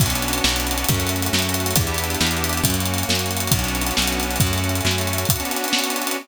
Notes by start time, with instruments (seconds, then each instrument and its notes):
0.00 electric bass (finger) B1, accordion D4 F#4, kick, closed hi-hat
0.05 accordion B3 C#4, closed hi-hat
0.10 closed hi-hat
0.15 closed hi-hat
0.22 closed hi-hat
0.28 closed hi-hat
0.33 closed hi-hat
0.38 closed hi-hat
0.44 electric bass (finger) B1, snare
0.49 closed hi-hat
0.56 closed hi-hat
0.60 closed hi-hat
0.67 closed hi-hat
0.71 closed hi-hat
0.78 closed hi-hat
0.84 accordion F#4, closed hi-hat
0.89 electric bass (finger) F#2, accordion C#4, kick, closed hi-hat
0.93 accordion A3, closed hi-hat
1.00 closed hi-hat
1.07 closed hi-hat
1.09 closed hi-hat
1.16 closed hi-hat
1.22 closed hi-hat
1.26 closed hi-hat
1.33 electric bass (finger) F#2, snare
1.39 closed hi-hat
1.42 closed hi-hat
1.49 closed hi-hat
1.54 closed hi-hat
1.60 closed hi-hat
1.66 closed hi-hat
1.71 closed hi-hat
1.76 electric bass (finger) E2, accordion E4 G4, kick, closed hi-hat
1.81 accordion B3 D4, closed hi-hat
1.87 closed hi-hat
1.94 closed hi-hat
1.98 closed hi-hat
2.04 closed hi-hat
2.10 closed hi-hat
2.14 closed hi-hat
2.21 electric bass (finger) E2, snare
2.27 closed hi-hat
2.31 closed hi-hat
2.37 closed hi-hat
2.44 closed hi-hat
2.49 closed hi-hat
2.53 closed hi-hat
2.57 closed hi-hat
2.64 electric bass (finger) F#2, accordion C#4 F#4, kick, closed hi-hat
2.70 accordion A#3, closed hi-hat
2.74 closed hi-hat
2.80 closed hi-hat
2.85 closed hi-hat
2.94 closed hi-hat
2.98 closed hi-hat
3.03 closed hi-hat
3.09 electric bass (finger) F#2, snare
3.15 closed hi-hat
3.19 closed hi-hat
3.26 closed hi-hat
3.31 closed hi-hat
3.37 closed hi-hat
3.40 closed hi-hat
3.47 closed hi-hat
3.51 electric bass (finger) B1, accordion D4 F#4, kick, closed hi-hat
3.57 accordion B3 C#4, closed hi-hat
3.64 closed hi-hat
3.68 closed hi-hat
3.75 closed hi-hat
3.81 closed hi-hat
3.87 closed hi-hat
3.91 closed hi-hat
3.97 electric bass (finger) B1, snare
4.02 closed hi-hat
4.07 closed hi-hat
4.12 closed hi-hat
4.20 closed hi-hat
4.23 closed hi-hat
4.31 closed hi-hat
4.36 closed hi-hat
4.40 electric bass (finger) F#2, accordion C#4 F#4, kick, closed hi-hat
4.46 accordion A3, closed hi-hat
4.53 closed hi-hat
4.58 closed hi-hat
4.64 closed hi-hat
4.69 closed hi-hat
4.75 closed hi-hat
4.81 electric bass (finger) F#2, closed hi-hat
4.86 snare
4.91 closed hi-hat
4.98 closed hi-hat
5.01 closed hi-hat
5.07 closed hi-hat
5.13 closed hi-hat
5.18 closed hi-hat
5.25 kick, closed hi-hat
5.30 accordion D4 F#4, closed hi-hat
5.35 accordion B3 C#4, closed hi-hat
5.40 closed hi-hat
5.45 closed hi-hat
5.51 closed hi-hat
5.56 closed hi-hat
5.64 closed hi-hat
5.68 closed hi-hat
5.73 snare
5.79 closed hi-hat
5.84 closed hi-hat
5.90 closed hi-hat
5.96 closed hi-hat
6.02 closed hi-hat
6.07 closed hi-hat
6.11 closed hi-hat